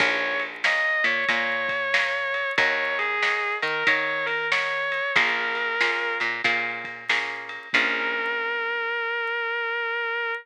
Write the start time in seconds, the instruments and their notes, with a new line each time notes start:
0.00 electric bass (finger) A#1, acoustic guitar (steel) A#4 C#5 F5 G#5, distortion guitar C#5, kick, crash
0.40 ride
0.64 acoustic guitar (steel) A#4 C#5 F5 G#5, distortion guitar D#5, snare
1.04 electric bass (finger) A#2, distortion guitar C#5, ride
1.28 electric bass (finger) A#2, acoustic guitar (steel) A#4 C#5 F5 G#5, distortion guitar C#5, kick, ride
1.69 kick, ride
1.94 acoustic guitar (steel) A#4 C#5 F5 G#5, snare
2.34 ride
2.58 electric bass (finger) D#2, acoustic guitar (steel) A#4 C#5 D#5 F#5, distortion guitar C#5, kick, ride
2.99 distortion guitar G#4, ride
3.22 acoustic guitar (steel) A#4 C#5 D#5 F#5, snare
3.62 electric bass (finger) D#3, distortion guitar A#4, ride
3.87 electric bass (finger) D#3, acoustic guitar (steel) A#4 C#5 D#5 F#5, distortion guitar C#5, kick, ride
4.26 distortion guitar A#4, ride
4.51 acoustic guitar (steel) A#4 C#5 D#5 F#5, distortion guitar C#5, snare
4.92 ride
5.16 electric bass (finger) A#1, acoustic guitar (steel) A#3 C#4 F4 G#4, distortion guitar A#4, kick, ride
5.55 ride
5.81 acoustic guitar (steel) A#3 C#4 F4 G#4, snare
6.20 electric bass (finger) A#2, ride
6.44 electric bass (finger) A#2, acoustic guitar (steel) A#3 C#4 F4 G#4, kick, ride
6.84 kick, ride
7.09 acoustic guitar (steel) A#3 C#4 F4 G#4, snare
7.49 ride
7.73 electric bass (finger) A#1, acoustic guitar (steel) A#3 C#4 F4 G#4, distortion guitar A#4, kick, crash